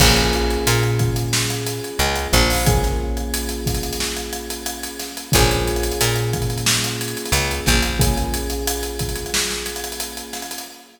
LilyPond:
<<
  \new Staff \with { instrumentName = "Electric Piano 1" } { \time 4/4 \key bes \minor \tempo 4 = 90 <bes des' f' aes'>1 | <bes des' f' aes'>1 | <bes des' f' aes'>1 | <bes des' f' aes'>1 | }
  \new Staff \with { instrumentName = "Electric Bass (finger)" } { \clef bass \time 4/4 \key bes \minor bes,,4 bes,2 des,8 bes,,8~ | bes,,1 | bes,,4 bes,2 des,8 bes,,8~ | bes,,1 | }
  \new DrumStaff \with { instrumentName = "Drums" } \drummode { \time 4/4 <cymc bd>16 hh16 hh16 hh16 hh16 hh16 <hh bd>16 hh16 sn16 hh16 hh16 hh16 hh16 hh16 <hh bd sn>16 hho16 | <hh bd>16 <hh sn>8 hh16 hh16 hh16 <hh bd sn>32 hh32 hh32 hh32 sn16 hh16 hh16 hh16 hh16 hh16 <hh sn>16 hh16 | <hh bd>16 hh16 hh32 hh32 hh32 hh32 hh16 hh16 <hh bd>32 hh32 hh32 hh32 sn16 hh16 hh32 hh32 hh32 hh32 hh16 hh16 <hh bd sn>16 hh16 | <hh bd>16 hh16 hh16 hh16 hh16 hh16 <hh bd>32 hh32 hh32 hh32 sn16 sn16 hh32 hh32 hh32 hh32 hh16 hh16 <hh sn>32 hh32 hh32 hh32 | }
>>